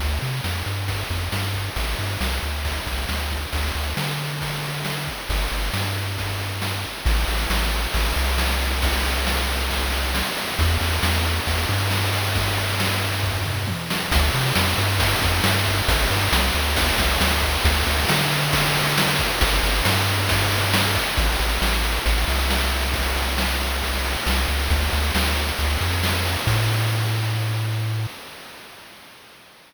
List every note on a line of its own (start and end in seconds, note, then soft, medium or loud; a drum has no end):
0.00 0.19 D2 medium
0.00 kick loud
0.00 ride loud
0.21 0.41 C3 medium
0.21 ride medium
0.44 0.63 F2 medium
0.44 snare medium
0.66 1.04 G2 medium
0.66 ride medium
0.88 kick medium
0.88 ride medium
1.10 1.29 F2 medium
1.10 kick medium
1.10 ride medium
1.32 1.70 G2 medium
1.32 snare loud
1.54 kick medium
1.54 ride medium
1.76 1.95 A1 medium
1.76 kick loud
1.76 ride loud
1.99 2.17 G2 medium
1.99 ride medium
2.21 2.39 C2 medium
2.21 snare loud
2.42 2.80 D2 medium
2.42 ride medium
2.65 kick medium
2.65 ride loud
2.87 3.06 C2 medium
2.87 kick medium
2.87 ride medium
3.09 3.46 D2 medium
3.09 snare medium
3.31 kick medium
3.31 ride medium
3.53 3.72 D2 medium
3.53 kick medium
3.53 ride loud
3.75 3.94 D2 medium
3.75 ride medium
3.97 5.09 D3 medium
3.97 snare loud
4.19 ride medium
4.41 kick medium
4.41 ride loud
4.63 ride medium
4.85 snare loud
5.07 kick medium
5.07 ride medium
5.29 5.48 G1 medium
5.29 kick loud
5.29 ride loud
5.52 5.70 G1 medium
5.52 ride medium
5.74 6.86 G2 medium
5.74 snare loud
5.96 ride medium
6.18 kick medium
6.18 ride medium
6.39 ride medium
6.62 snare loud
6.84 kick medium
6.84 ride medium
7.05 7.25 A1 loud
7.05 kick loud
7.05 crash loud
7.17 ride medium
7.28 7.47 A1 medium
7.28 snare medium
7.28 ride medium
7.39 ride medium
7.50 7.87 A1 medium
7.50 snare loud
7.61 ride medium
7.72 ride medium
7.83 ride medium
7.94 8.13 A1 medium
7.94 kick loud
7.94 ride loud
8.05 ride medium
8.16 10.23 C2 loud
8.16 ride medium
8.27 ride medium
8.38 snare loud
8.49 ride medium
8.60 ride medium
8.71 ride medium
8.82 kick loud
8.82 ride loud
8.93 ride medium
9.05 snare medium
9.05 ride medium
9.15 ride medium
9.27 snare loud
9.37 ride medium
9.49 ride medium
9.59 ride medium
9.70 kick medium
9.70 ride loud
9.82 ride medium
9.92 ride medium
10.03 ride medium
10.15 snare loud
10.26 ride medium
10.37 ride medium
10.48 ride medium
10.59 10.78 E2 loud
10.59 kick loud
10.59 ride loud
10.70 ride medium
10.81 11.00 E2 medium
10.81 snare medium
10.81 ride medium
10.91 ride medium
11.03 11.40 E2 medium
11.03 snare loud
11.14 ride medium
11.25 ride medium
11.36 ride medium
11.47 11.66 E2 medium
11.47 kick loud
11.47 ride loud
11.58 ride medium
11.69 13.75 G2 medium
11.69 ride medium
11.80 ride medium
11.91 snare loud
12.03 ride medium
12.13 ride loud
12.24 ride medium
12.35 kick loud
12.35 ride loud
12.46 ride medium
12.57 snare medium
12.57 ride medium
12.69 ride medium
12.80 snare loud
12.90 ride medium
13.02 ride medium
13.12 ride medium
13.23 kick medium
13.23 floor tom medium
13.45 mid tom medium
13.67 high tom medium
13.90 snare loud
14.11 14.30 D2 loud
14.11 kick loud
14.11 ride loud
14.34 14.53 C3 loud
14.34 ride medium
14.56 14.75 F2 medium
14.56 snare loud
14.78 15.15 G2 medium
14.78 ride loud
15.00 kick loud
15.00 ride loud
15.22 15.41 F2 loud
15.22 kick loud
15.22 ride medium
15.44 15.82 G2 loud
15.44 snare loud
15.66 kick loud
15.66 ride loud
15.88 16.07 A1 loud
15.88 kick loud
15.88 ride loud
16.10 16.29 G2 medium
16.10 ride medium
16.32 16.51 C2 loud
16.32 snare loud
16.54 16.92 D2 medium
16.54 ride medium
16.76 kick loud
16.76 ride loud
16.98 17.17 C2 medium
16.98 kick loud
16.98 ride loud
17.21 17.58 D2 medium
17.21 snare loud
17.42 kick loud
17.42 ride medium
17.65 17.83 D2 loud
17.65 kick loud
17.65 ride loud
17.87 18.06 D2 medium
17.87 ride medium
18.09 19.21 D3 medium
18.09 snare loud
18.32 ride medium
18.53 kick loud
18.53 ride loud
18.75 ride loud
18.98 snare loud
19.19 kick loud
19.19 ride medium
19.41 19.60 G1 loud
19.41 kick loud
19.41 ride loud
19.63 19.82 G1 loud
19.63 ride loud
19.85 20.98 G2 loud
19.85 snare loud
20.08 ride medium
20.29 kick loud
20.29 ride loud
20.51 ride medium
20.74 snare loud
20.95 kick loud
20.95 ride medium
21.17 21.36 A1 loud
21.17 kick loud
21.17 crash loud
21.29 ride medium
21.39 21.59 A1 medium
21.39 snare medium
21.39 ride medium
21.50 ride medium
21.62 21.99 A1 medium
21.62 snare loud
21.73 ride medium
21.84 ride medium
21.95 ride medium
22.06 22.25 A1 loud
22.06 kick loud
22.06 ride loud
22.18 ride medium
22.28 24.16 C2 medium
22.28 ride medium
22.39 ride medium
22.50 snare loud
22.61 ride medium
22.72 ride medium
22.83 ride medium
22.94 kick loud
22.94 ride loud
23.05 ride medium
23.16 snare medium
23.16 ride medium
23.28 ride medium
23.38 snare loud
23.49 ride medium
23.60 ride medium
23.71 ride medium
23.82 kick medium
23.82 ride loud
23.93 ride medium
24.05 ride medium
24.16 ride medium
24.26 24.46 C2 medium
24.26 snare loud
24.38 ride medium
24.48 24.68 C#2 medium
24.48 ride medium
24.60 ride medium
24.70 24.89 D2 loud
24.70 kick loud
24.70 ride loud
24.81 ride medium
24.92 25.11 D2 medium
24.92 snare medium
24.92 ride medium
25.03 ride medium
25.15 25.52 D2 medium
25.15 snare loud
25.26 ride medium
25.36 ride medium
25.49 ride medium
25.58 25.78 D2 medium
25.58 kick medium
25.58 ride loud
25.70 ride medium
25.81 26.37 F2 medium
25.81 ride medium
25.92 ride medium
26.03 snare loud
26.14 ride medium
26.25 ride medium
26.35 ride medium
26.47 28.07 A2 loud
26.47 kick loud
26.47 crash loud